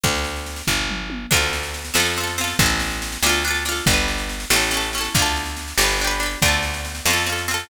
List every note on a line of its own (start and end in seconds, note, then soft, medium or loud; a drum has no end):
0.04 0.62 D2 medium
0.04 kick medium
0.04 snare medium
0.15 snare medium
0.24 snare medium
0.36 snare soft
0.46 snare medium
0.56 snare medium
0.67 1.26 G1 medium
0.67 kick medium
0.67 floor tom medium
0.89 mid tom medium
1.10 high tom medium
1.31 1.91 D2 medium
1.31 1.89 D4 loud
1.31 1.89 F4 loud
1.31 kick medium
1.31 snare medium
1.31 crash medium
1.37 1.89 A4 medium
1.42 snare medium
1.53 snare medium
1.63 snare medium
1.74 snare medium
1.85 snare medium
1.94 2.54 F2 medium
1.94 2.13 C4 medium
1.94 2.13 F4 medium
1.94 snare medium
2.00 2.13 A4 medium
2.05 snare medium
2.16 2.37 C4 medium
2.16 snare medium
2.21 2.37 F4 medium
2.21 2.37 A4 medium
2.27 snare medium
2.38 2.58 C4 medium
2.38 2.58 F4 medium
2.38 snare medium
2.44 2.58 A4 medium
2.44 snare medium
2.59 3.18 A1 medium
2.59 3.19 C4 medium
2.59 3.19 E4 medium
2.59 kick medium
2.59 snare medium
2.66 3.19 A4 loud
2.66 snare medium
2.80 snare medium
2.91 snare medium
3.02 snare medium
3.12 snare medium
3.23 3.81 D2 medium
3.23 3.43 D4 loud
3.23 3.43 F4 loud
3.23 snare loud
3.29 3.43 A4 medium
3.34 snare medium
3.44 3.64 D4 medium
3.44 3.64 F4 medium
3.44 snare medium
3.51 3.64 A4 medium
3.55 snare medium
3.65 3.85 D4 medium
3.65 3.85 F4 medium
3.65 snare medium
3.72 3.85 A4 medium
3.76 snare medium
3.86 4.45 G1 medium
3.86 4.46 D4 medium
3.86 kick medium
3.86 snare medium
3.91 4.46 G4 medium
3.91 4.46 B4 loud
3.98 snare medium
4.08 snare medium
4.18 snare medium
4.29 snare medium
4.40 snare medium
4.50 5.09 A1 medium
4.50 4.70 C#4 medium
4.50 4.70 E4 medium
4.50 snare loud
4.56 4.70 A4 medium
4.61 snare medium
4.71 4.91 C#4 medium
4.71 4.91 E4 medium
4.71 snare medium
4.77 4.91 A4 medium
4.83 snare medium
4.93 5.14 C#4 medium
4.93 snare medium
4.98 5.14 E4 medium
4.98 5.14 A4 medium
5.04 snare medium
5.15 5.74 D2 medium
5.15 5.75 D4 medium
5.15 kick medium
5.15 snare medium
5.19 5.75 F4 loud
5.19 5.75 A4 loud
5.26 snare medium
5.36 snare medium
5.46 snare medium
5.57 snare medium
5.68 snare medium
5.78 6.36 G1 medium
5.78 5.98 D4 medium
5.78 5.98 G4 medium
5.78 snare loud
5.84 5.98 B4 medium
5.89 snare medium
5.99 6.19 D4 medium
5.99 snare medium
6.04 6.21 G4 medium
6.04 6.21 B4 medium
6.10 snare medium
6.20 6.39 D4 medium
6.20 6.39 G4 medium
6.20 snare medium
6.26 6.39 B4 medium
6.31 snare medium
6.42 7.01 D2 medium
6.42 7.01 D4 loud
6.42 7.01 F4 loud
6.42 kick medium
6.42 snare medium
6.42 crash medium
6.48 7.01 A4 medium
6.53 snare medium
6.63 snare medium
6.74 snare medium
6.85 snare medium
6.95 snare medium
7.05 7.64 F2 medium
7.05 7.26 C4 medium
7.05 snare medium
7.10 7.27 F4 medium
7.10 7.27 A4 medium
7.17 snare medium
7.26 7.46 C4 medium
7.26 7.46 F4 medium
7.26 snare medium
7.32 7.46 A4 medium
7.38 snare medium
7.48 7.68 C4 medium
7.48 7.68 F4 medium
7.48 snare medium
7.54 7.68 A4 medium
7.59 snare medium